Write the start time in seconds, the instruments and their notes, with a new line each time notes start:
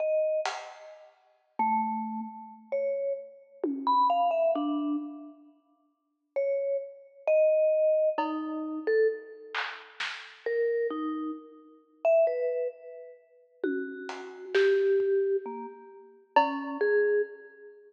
0.00 vibraphone D#5
0.45 closed hi-hat
1.59 vibraphone A3
2.72 vibraphone C#5
3.64 high tom
3.87 vibraphone B5
4.10 vibraphone F5
4.31 vibraphone E5
4.55 vibraphone D4
6.36 vibraphone C#5
7.27 vibraphone D#5
8.18 vibraphone D#4, cowbell
8.87 vibraphone A4
9.55 clap
10.00 snare
10.46 vibraphone A#4
10.91 vibraphone D#4
12.05 vibraphone E5
12.27 vibraphone B4
13.64 vibraphone F#4, high tom
14.09 closed hi-hat
14.55 vibraphone G4, snare
15.00 kick
15.46 vibraphone A#3
16.36 vibraphone C#4, cowbell
16.81 vibraphone G#4